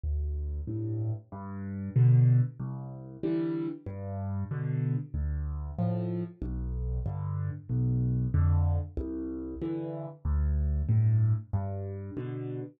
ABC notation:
X:1
M:4/4
L:1/8
Q:1/4=94
K:C
V:1 name="Acoustic Grand Piano" clef=bass
D,,2 [G,,A,,]2 G,,2 [B,,D,]2 | C,,2 [D,E,G,]2 G,,2 [B,,D,]2 | D,,2 [A,,F,]2 B,,,2 [G,,D,]2 | B,,,2 [F,,D,]2 C,,2 [G,,D,E,]2 |
D,,2 [G,,A,,]2 G,,2 [B,,D,]2 |]